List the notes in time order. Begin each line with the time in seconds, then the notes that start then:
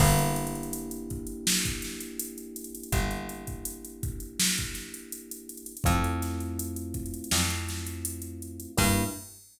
0.00 G1 A#3 D4 E4 G4, kick, crash
0.19 closed hi-hat
0.36 closed hi-hat
0.47 closed hi-hat
0.55 closed hi-hat
0.63 closed hi-hat
0.73 closed hi-hat
0.91 closed hi-hat
1.10 kick, closed hi-hat
1.27 closed hi-hat
1.47 snare
1.65 kick, closed hi-hat
1.82 snare, closed hi-hat
2.00 closed hi-hat
2.20 closed hi-hat
2.38 closed hi-hat
2.56 closed hi-hat
2.64 closed hi-hat
2.75 closed hi-hat
2.83 closed hi-hat
2.92 G1, kick, closed hi-hat
3.11 closed hi-hat
3.29 closed hi-hat
3.47 kick, closed hi-hat
3.65 closed hi-hat
3.85 closed hi-hat
4.03 kick, closed hi-hat
4.20 closed hi-hat
4.39 snare
4.58 kick, closed hi-hat
4.74 snare, closed hi-hat
4.94 closed hi-hat
5.12 closed hi-hat
5.31 closed hi-hat
5.49 closed hi-hat
5.57 closed hi-hat
5.66 closed hi-hat
5.77 closed hi-hat
5.84 F2 A3 C4 E4 F4, kick, closed hi-hat
6.04 closed hi-hat
6.22 snare, closed hi-hat
6.40 closed hi-hat
6.59 closed hi-hat
6.76 closed hi-hat
6.94 kick, closed hi-hat
7.06 closed hi-hat
7.14 closed hi-hat
7.24 closed hi-hat
7.31 F2, snare
7.50 closed hi-hat
7.69 snare, closed hi-hat
7.87 closed hi-hat
8.05 closed hi-hat
8.22 closed hi-hat
8.42 closed hi-hat
8.60 closed hi-hat
8.77 G2 A#3 D4 E4 G4, kick, crash